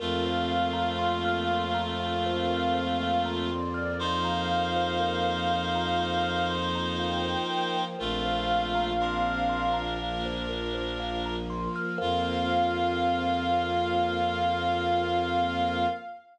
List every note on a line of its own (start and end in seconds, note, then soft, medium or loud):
0.00 7.36 F2 loud
0.00 3.50 A3 medium
0.00 3.96 A#3 medium
0.00 3.96 C4 medium
0.00 3.50 F4 loud
0.00 3.96 F4 medium
0.00 0.21 A#4 loud
0.00 1.77 F5 medium
0.26 0.48 C5 medium
0.52 0.74 F5 medium
0.73 0.96 A#5 medium
0.99 1.21 C6 medium
1.25 1.48 F6 medium
1.51 1.74 C6 medium
1.75 1.97 A#5 medium
1.99 3.22 F5 medium
1.99 2.22 F5 medium
2.26 2.48 C5 medium
2.50 2.72 A#4 medium
2.75 2.97 C5 medium
2.99 3.22 F5 medium
3.26 3.48 A#5 medium
3.51 3.98 D5 medium
3.51 3.74 C6 medium
3.74 3.97 F6 medium
3.99 7.96 F3 medium
3.99 7.96 A#3 medium
3.99 7.84 D#4 medium
3.99 7.96 F4 medium
3.99 7.84 C5 loud
3.99 6.43 F5 medium
3.99 4.23 C6 medium
4.25 4.47 A#5 medium
4.51 4.73 F5 medium
4.76 4.98 C5 medium
5.00 5.22 A#4 medium
5.24 5.47 C5 medium
5.50 5.73 F5 medium
5.75 5.98 A#5 medium
6.00 6.23 C6 medium
6.23 6.46 F6 medium
6.51 6.73 C6 medium
6.75 6.98 A#5 medium
7.00 7.22 F5 medium
7.00 7.82 G5 medium
7.24 7.47 C5 medium
7.50 7.73 A#4 medium
7.75 7.97 C5 medium
7.99 11.68 A#1 loud
7.99 8.93 A3 medium
7.99 9.98 A#3 medium
7.99 9.98 C4 medium
7.99 8.93 F4 loud
7.99 9.98 F4 medium
7.99 8.21 A#4 loud
7.99 9.79 F5 medium
8.25 8.47 C5 medium
8.51 8.73 F5 medium
8.75 8.98 A#5 medium
9.00 11.36 D4 medium
9.00 11.36 A#4 medium
9.00 9.24 C6 medium
9.27 9.49 F6 medium
9.49 9.72 C6 medium
9.74 9.96 A#5 medium
10.00 11.98 F3 medium
10.00 11.98 A#3 medium
10.00 11.98 F4 medium
10.00 10.22 F5 medium
10.26 10.48 C5 medium
10.49 10.72 A#4 medium
10.74 10.96 C5 medium
11.00 11.22 F5 medium
11.25 11.48 A#5 medium
11.50 11.72 C6 medium
11.76 11.98 F6 medium
11.98 15.87 F2 loud
11.98 15.87 A#3 loud
11.98 15.87 C4 loud
11.98 15.87 F4 loud
11.98 15.88 F4 loud
11.98 15.85 A#4 loud
11.98 15.85 C5 loud
11.98 15.85 F5 loud
11.98 15.86 F5 loud